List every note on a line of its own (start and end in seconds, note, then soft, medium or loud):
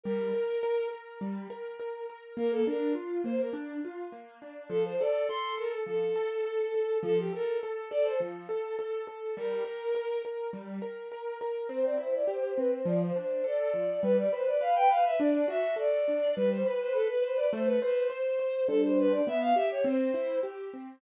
0.04 0.32 G3 loud
0.04 0.88 A#4 medium
0.33 0.60 A#4 medium
0.63 0.89 A#4 medium
0.93 1.19 A#4 medium
1.21 1.47 G3 medium
1.50 1.76 A#4 medium
1.80 2.06 A#4 medium
2.10 2.36 A#4 medium
2.37 2.63 A#3 medium
2.37 2.52 A#4 medium
2.52 2.66 A4 medium
2.67 2.93 D4 medium
2.67 2.93 A#4 medium
2.95 3.21 F4 medium
3.24 3.50 A#3 medium
3.24 3.39 C5 medium
3.40 3.54 A#4 medium
3.53 3.79 D4 medium
3.85 4.11 F4 medium
4.12 4.38 A#3 medium
4.42 4.68 D4 medium
4.69 4.96 F3 loud
4.69 4.83 A4 medium
4.85 4.99 C5 medium
5.00 5.27 A4 medium
5.00 5.26 D5 medium
5.29 5.55 A4 medium
5.29 5.55 C6 medium
5.58 5.84 A4 medium
5.58 5.72 A#4 medium
5.86 6.13 F3 medium
5.86 6.98 A4 medium
6.16 6.42 A4 medium
6.45 6.71 A4 medium
6.74 7.00 A4 medium
7.03 7.29 F3 loud
7.03 7.18 A4 medium
7.19 7.33 G4 medium
7.33 7.59 A4 medium
7.33 7.59 A#4 medium
7.63 7.89 A4 medium
7.91 8.18 A4 medium
7.91 8.04 D5 medium
8.04 8.18 C5 medium
8.20 8.47 F3 medium
8.49 8.75 A4 medium
8.79 9.05 A4 medium
9.07 9.34 A4 medium
9.37 9.63 G3 loud
9.37 10.22 A#4 medium
9.65 9.91 A#4 medium
9.95 10.21 A#4 medium
10.25 10.51 A#4 medium
10.53 10.79 G3 medium
10.82 11.08 A#4 medium
11.12 11.38 A#4 medium
11.41 11.67 A#4 medium
11.69 11.95 C4 loud
11.69 11.83 C5 medium
11.85 11.99 D5 medium
11.97 12.24 E4 medium
11.97 12.12 C5 medium
12.15 12.29 D5 medium
12.28 12.54 G4 medium
12.28 12.42 C5 medium
12.42 12.56 C5 medium
12.58 12.84 C4 medium
12.58 12.72 B4 medium
12.70 12.84 C5 medium
12.86 13.12 F3 loud
12.86 13.00 D5 medium
13.03 13.15 C5 medium
13.16 13.42 D4 medium
13.16 13.43 C5 medium
13.44 13.70 A4 medium
13.44 14.01 D5 medium
13.74 14.00 F3 medium
14.03 14.29 G3 loud
14.03 14.17 B4 medium
14.17 14.31 D5 medium
14.32 14.59 B4 medium
14.32 14.46 C5 medium
14.47 14.61 D5 medium
14.61 14.87 B4 medium
14.61 14.75 F5 medium
14.75 14.89 G5 medium
14.89 15.16 B4 medium
14.89 15.04 F5 medium
15.05 15.19 E5 medium
15.19 15.46 D4 loud
15.19 15.31 D5 medium
15.32 15.46 D5 medium
15.48 15.74 F#4 medium
15.48 15.75 E5 medium
15.76 16.02 A4 medium
15.76 16.33 D5 medium
16.08 16.34 D4 medium
16.36 16.63 G3 loud
16.36 16.50 B4 medium
16.51 16.65 C5 medium
16.66 16.80 B4 medium
16.66 16.92 B4 medium
16.81 16.95 C5 medium
16.93 17.07 A4 medium
16.93 17.19 B4 medium
17.09 17.23 B4 medium
17.21 17.48 B4 medium
17.21 17.35 C5 medium
17.36 17.50 D5 medium
17.52 17.79 A3 loud
17.52 17.66 C5 medium
17.66 17.80 B4 medium
17.80 18.08 B4 medium
17.80 18.08 C5 medium
18.10 18.36 C5 medium
18.10 18.64 C5 medium
18.39 18.66 C5 medium
18.67 19.21 G3 medium
18.67 19.21 D4 loud
18.67 18.81 A4 medium
18.67 19.21 C5 loud
18.83 18.96 C5 medium
18.99 19.13 B4 medium
19.12 19.26 D5 medium
19.27 19.53 B3 medium
19.27 19.41 E5 medium
19.41 19.55 F5 medium
19.55 19.82 G4 medium
19.55 19.69 E5 medium
19.71 19.85 C#5 medium
19.84 20.11 C4 loud
19.84 20.38 C5 medium
20.14 20.40 E4 medium
20.43 20.69 G4 medium
20.74 21.00 C4 medium